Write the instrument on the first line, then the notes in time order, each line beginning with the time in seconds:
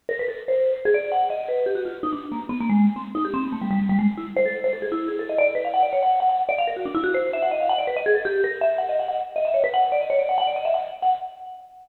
vibraphone
0.09 A#4
0.19 B4
0.28 A4
0.48 C5
0.85 G#4
0.94 D5
1.11 F#5
1.30 D#5
1.48 B4
1.66 G4
1.75 F#4
1.85 F4
2.03 D#4
2.12 D4
2.31 A#3
2.49 B3
2.60 A#3
2.69 G#3
2.96 C4
3.14 D#4
3.24 G4
3.33 C4
3.43 B3
3.52 A3
3.61 G3
3.70 G3
3.79 G3
3.89 G3
3.99 G#3
4.17 E4
4.36 C5
4.45 A4
4.64 C5
4.73 A4
4.82 G#4
4.91 E4
5.08 G#4
5.19 A4
5.29 D#5
5.38 D5
5.55 B4
5.64 F5
5.73 F#5
5.82 D5
5.92 C#5
6.02 F#5
6.20 F#5
6.29 F#5
6.49 D5
6.58 F5
6.67 A#4
6.76 F#4
6.85 D4
6.94 E4
7.03 F#4
7.14 C5
7.33 E5
7.42 F#5
7.51 D#5
7.60 F5
7.69 F#5
7.78 D5
7.87 B4
7.96 D#5
8.06 G#4
8.15 A4
8.25 G4
8.44 A#4
8.61 E5
8.78 F#5
8.89 D#5
8.99 F#5
9.08 F#5
9.35 D#5
9.45 E5
9.54 C#5
9.63 B4
9.73 F#5
9.83 F#5
9.92 D5
10.01 D#5
10.10 C#5
10.19 D5
10.29 F#5
10.38 F#5
10.47 D5
10.56 D#5
10.65 E5
10.74 F#5
11.02 F#5